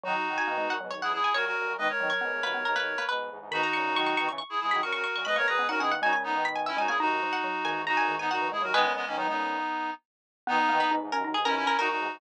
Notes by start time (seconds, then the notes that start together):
0.04 D#3 F#3 D#4 F#4
0.28 D#3 F#3
0.38 G#5
0.47 B2 D#3 A#3
0.58 G#2 B2 G#3
0.70 F#2 A#2 F#5
0.81 G#2 B2 F#3
0.91 B1 D#2 C#5
1.02 C#2 E2 E4 G#4 F#5
1.13 E4 G#4
1.24 G#5
1.34 F#2 A#2 F#4 A#4 C#5
1.45 F#4 A#4
1.58 F#2 A#2
1.67 F#2 A#2
1.78 B2 D#3 G#3 B4 D#5
1.89 A#4 C#5
2.00 B2 D#3 F#3
2.10 C#5
2.21 G#2 B2 B3
2.31 E2 G#2
2.43 D#2 F#2 A#3 B4
2.53 D#2 F#2 B3
2.65 B1 D#2 A#4
2.76 B1 D#2 A#3 B4
2.98 A#3 B4
3.09 G#2 B2 B4
3.30 E2 G#2
3.39 E2 G#2
3.51 G#2 B2 D#3 D#4 F#4 B5
3.63 A#5
3.73 A#2 C#3 C#6
3.85 A#2 C#3
3.96 D#3 F#3 C#6
4.07 C#6
4.17 B2 D#3 C#6
4.29 C#3 E3 C#6
4.38 C#6
4.50 E4 G#4
4.61 E3 G#3 E4 G#4
4.71 D#3 F#3 B5
4.82 A#2 C#3 F#4 A#4 C#6
4.93 F#4 A#4 C#6
5.04 C#6
5.15 F#2 A#2 C#6
5.25 G#2 B2 G#3 B4 D#5 B5
5.36 G#2 B2 A#3 A#4 C#5 C#6
5.47 F#2 A#2 G#4 B4 A#5
5.58 G#2 B2 B3
5.68 A#2 C#3 D#4 F#4 A#4 F#5
5.79 B2 D#3 C#4 E4 G#4 F#5
5.91 A#3 F#5
6.02 A#2 C#3 G#3 D#4 F#4 G#5
6.13 G#5
6.24 B3 D#4
6.34 B2 D#3
6.45 B5
6.56 G#5
6.66 C#4 E4 E5
6.77 A#2 C#3 G#3 D#4 F#4 G#5
6.88 A#3 E4 G#4 G#5
7.00 D#2 F#2 D#4 F#4
7.23 F3
7.33 F#5
7.44 F#3
7.63 E2 G#2 D#3 G#5
7.87 D#4 F#4 A#5
7.97 F#2 A#2 G#5
8.08 E2 G#2 D#3
8.19 B3 D#4 G#5
8.30 F#2 A#2 D#4 F#4 F#5
8.41 E3
8.52 E2 G#2 G#3 E4 G#4
8.62 D#2 F#2 F#3 F#4 A#4
8.74 B2 D#3 G#3 B3 G#4 B4
8.84 A#2 C#3
8.95 G#3 B3
9.07 B2 D#3 A#3 C#4
9.17 F#3 B3 D#4
9.27 A#2 C#3 G#3 B3 D#4
10.47 B2 D#3 B3 D#4
10.69 B2 D#3 A#3
10.80 B4
10.89 G#2 B2 D#4
11.01 E2 G#2
11.12 D#2 F#2 C#4 A#4
11.24 D#2 F#2 D#4
11.34 B1 D#2 G#4
11.45 B1 D#2 C#4 E4 A#4
11.56 C#4 E4
11.66 C#4 A#4
11.78 F#2 A#2 D#4 F#4 A#4
11.89 D#4 F#4
11.98 E2 G#2
12.13 E2 G#2